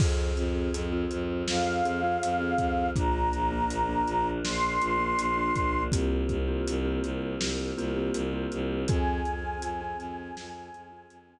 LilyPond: <<
  \new Staff \with { instrumentName = "Choir Aahs" } { \time 4/4 \key f \minor \tempo 4 = 81 r2 f''2 | bes''2 c'''2 | r1 | aes''1 | }
  \new Staff \with { instrumentName = "Vibraphone" } { \time 4/4 \key f \minor <c' f' aes'>8. <c' f' aes'>8 <c' f' aes'>4~ <c' f' aes'>16 <c' f' aes'>16 <c' f' aes'>8 <c' f' aes'>8. | <bes d' f'>8. <bes d' f'>8 <bes d' f'>4~ <bes d' f'>16 <bes d' f'>16 <bes d' f'>8 <bes d' f'>8. | <bes c' f' g'>8. <bes c' f' g'>8 <bes c' f' g'>4~ <bes c' f' g'>16 <bes c' f' g'>16 <bes c' f' g'>8 <bes c' f' g'>8. | <c' f' aes'>8. <c' f' aes'>8 <c' f' aes'>4~ <c' f' aes'>16 <c' f' aes'>16 <c' f' aes'>8 <c' f' aes'>8. | }
  \new Staff \with { instrumentName = "Violin" } { \clef bass \time 4/4 \key f \minor f,8 f,8 f,8 f,8 f,8 f,8 f,8 f,8 | bes,,8 bes,,8 bes,,8 bes,,8 bes,,8 bes,,8 bes,,8 bes,,8 | c,8 c,8 c,8 c,8 c,8 c,8 c,8 c,8 | f,8 f,8 f,8 f,8 f,8 f,8 f,8 r8 | }
  \new Staff \with { instrumentName = "Choir Aahs" } { \time 4/4 \key f \minor <c' f' aes'>1 | <bes d' f'>1 | <bes c' f' g'>1 | <c' f' aes'>1 | }
  \new DrumStaff \with { instrumentName = "Drums" } \drummode { \time 4/4 <cymc bd>8 hh8 hh8 hh8 sn8 hh8 hh8 <hh bd>8 | <hh bd>8 hh8 hh8 hh8 sn8 hh8 hh8 <hh bd>8 | <hh bd>8 <hh bd>8 hh8 hh8 sn8 hh8 hh8 hh8 | <hh bd>8 hh8 hh8 hh8 sn8 hh8 hh4 | }
>>